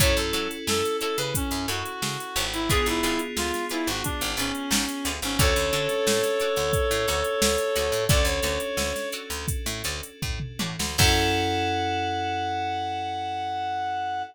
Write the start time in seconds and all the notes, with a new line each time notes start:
0.00 F#2 C#4 E4 F#4 A4 C#5, kick, closed hi-hat
0.16 F#2 A4, closed hi-hat
0.33 F#3 E4 F#4 A4 C#5, snare, closed hi-hat
0.51 closed hi-hat
0.67 F#2 A4, snare
0.84 snare, closed hi-hat
1.01 E4 F#4 A4 C#5, closed hi-hat
1.18 C#3 B4, closed hi-hat
1.35 C#4, kick, closed hi-hat
1.51 F#2, closed hi-hat
1.68 F#2 E4 F#4 A4 C#5, closed hi-hat
1.86 closed hi-hat
2.02 C#3, snare
2.20 closed hi-hat
2.36 G#1 E4 F#4 A4 C#5, snare, closed hi-hat
2.53 E4, closed hi-hat
2.70 B3 D4 F4 G#4 B4 D5, kick, closed hi-hat
2.86 G#1 E4, closed hi-hat
3.03 G#1 F4 G#4 B4 D5, closed hi-hat
3.19 closed hi-hat
3.37 D2 F4, snare
3.54 snare, closed hi-hat
3.69 E4 F4 G#4 B4 D5, snare, closed hi-hat
3.87 G#1 F#4, closed hi-hat
4.04 D4, kick, closed hi-hat
4.21 G#1, closed hi-hat
4.37 G#1 C#4 F4 G#4 B4 D5, closed hi-hat
4.55 closed hi-hat
4.71 G#1, snare
4.89 snare, closed hi-hat
5.05 D2 F4 G#4 B4 D5, closed hi-hat
5.22 G#1 C#4, snare, closed hi-hat
5.39 D2 C#4 D4 F#4 A4 C#5 D5, kick, closed hi-hat
5.56 D2, closed hi-hat
5.73 D3 F#4 A4 C#5 D5, closed hi-hat
5.89 snare, closed hi-hat
6.07 A2, snare
6.23 snare, closed hi-hat
6.40 F#4 A4 C#5 D5, closed hi-hat
6.56 D2, closed hi-hat
6.73 kick, closed hi-hat
6.91 A2, closed hi-hat
7.08 D2 F#4 A4 C#5 D5, snare, closed hi-hat
7.24 closed hi-hat
7.42 D2, snare
7.58 closed hi-hat
7.76 D2 F#4 A4 C#5 D5, closed hi-hat
7.92 A2, closed hi-hat
8.08 D2 C#4 D4 F#4 A4 C#5 D5, kick, closed hi-hat
8.25 D2 C#5, snare, closed hi-hat
8.43 D2 F#4 A4 C#5 D5, snare, closed hi-hat
8.60 closed hi-hat
8.77 D2, snare
8.96 snare, closed hi-hat
9.12 F#4 A4 C#5 D5, closed hi-hat
9.30 D2, closed hi-hat
9.48 kick, closed hi-hat
9.66 A2, closed hi-hat
9.84 D2 F#4 A4 C#5 D5, closed hi-hat
10.03 closed hi-hat
10.22 A2, kick, floor tom
10.40 mid tom
10.59 A2 F#4 A4 C#5 D5, high tom
10.79 D2, snare
10.98 F#2 C#4 E4 F#4 A4 C#5 F#5, kick, crash